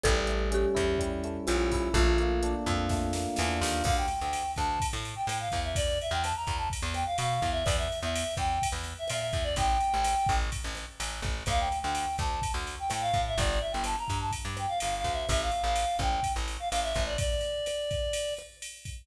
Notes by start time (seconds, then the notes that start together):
0.03 A1 G3 A4, kick, cross-stick, closed hi-hat
0.27 A3, closed hi-hat
0.51 C#4 G4, closed hi-hat
0.75 E2 E4, kick, cross-stick, closed hi-hat
0.98 G3, kick, closed hi-hat
1.24 A3, closed hi-hat
1.47 A#1 C#4 F4, cross-stick, closed hi-hat
1.72 E4, kick, open hi-hat
1.93 A#1 A3 F4, kick, closed hi-hat
2.18 A#3, closed hi-hat
2.43 D4, cross-stick, closed hi-hat
2.66 F2 F4, kick, closed hi-hat
2.89 A3, kick, snare
3.13 A#3, snare
3.36 E2 D4, snare
3.61 D#2 F4, snare
3.84 D2 F5, kick, cross-stick, crash
3.97 G5
4.08 ride
4.20 D2 G5
4.33 ride
4.56 D2 A5, kick, cross-stick, ride
4.80 kick, ride
4.93 A2
5.05 ride
5.16 G5
5.27 A2 G5, cross-stick, ride
5.40 F5
5.52 E2, kick, ride
5.64 E5
5.75 D5, kick, ride
6.01 E5, ride
6.11 E2 G5
6.23 A5, cross-stick, ride
6.36 A#5
6.47 E2, kick, ride
6.57 A5
6.70 kick, ride
6.82 E2
6.94 G5, cross-stick, ride
7.06 F5
7.18 B2 F5, ride
7.35 F5
7.42 E2, kick, ride
7.52 E5
7.64 E2 D5, kick, cross-stick, ride
7.77 E5
7.92 ride
8.03 E2 E5
8.15 ride
8.37 E2 G5, kick, cross-stick, ride
8.62 kick, ride
8.72 E2
8.84 ride
8.99 E5
9.08 A#2 E5, cross-stick, ride
9.21 E5
9.33 E2, kick, ride
9.44 D5
9.56 A1 G5, kick, ride
9.80 ride
9.94 A1
10.04 cross-stick, ride
10.26 A1, kick, ride
10.52 kick, ride
10.64 A1
10.75 cross-stick, ride
11.00 A1, ride
11.22 A1, kick, ride
11.46 D2 F5, kick, cross-stick, ride
11.60 G5
11.72 ride
11.81 D2 G5
11.95 ride
12.18 D2 A5, kick, cross-stick, ride
12.42 kick, ride
12.54 D2
12.67 ride
12.79 G5
12.90 A2 G5, cross-stick, ride
13.01 F5
13.13 A2, kick, ride
13.27 E5
13.38 G1 D5, kick, ride
13.61 E5
13.72 G1 G5
13.84 A5, cross-stick, ride
13.98 A#5
14.08 G2, kick, ride
14.20 A5
14.31 kick, ride
14.45 G2
14.57 G5, cross-stick, ride
14.68 F5
14.79 G1 F5, ride
14.97 F5
15.04 D2, kick, ride
15.12 E5
15.29 A1 E5, kick, cross-stick, ride
15.41 F5
15.51 ride
15.63 A1 F5
15.76 ride
15.99 A1 G5, kick, cross-stick
16.23 kick, ride
16.36 A1
16.48 ride
16.60 F5
16.69 A1 F5, cross-stick, ride
16.83 E5
16.94 A1, kick, ride
17.06 D5
17.18 D5, kick, ride
17.41 ride
17.66 cross-stick, ride
17.91 kick, ride
18.13 ride
18.37 cross-stick, ride
18.62 ride
18.85 kick, ride